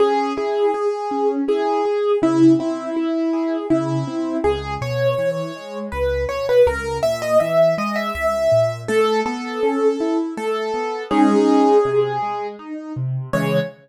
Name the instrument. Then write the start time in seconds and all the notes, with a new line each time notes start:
acoustic grand piano
0.00 C#4 G#4
0.37 E4 G#4
0.74 G#4
1.11 C#4
1.48 E4 G#4
1.85 G#4
2.22 C#3 E4
2.59 C4 E4
2.96 E4
3.33 G#4
3.70 C#3 E4
4.07 C4
4.44 C#2 G#4
4.81 B2 C#5
5.18 E3
5.56 G#3
5.92 C#2 B4
6.29 B2 C#5
6.49 B4
6.67 C#2 A#4
7.03 A#2 E5
7.22 D#5
7.40 E3 E5
7.78 G#3 D#5
7.96 E5
8.15 C#2 E5
8.52 A#2
8.88 A3 A4
9.26 B3 A4
9.63 C#4
10.00 E4
10.37 A3 A4
10.74 B3
11.11 G#3 C#4 D#4 G#4
11.85 C3
12.22 G#3
12.59 D#4
12.96 C3
13.33 C#3 E3 G#3 C#5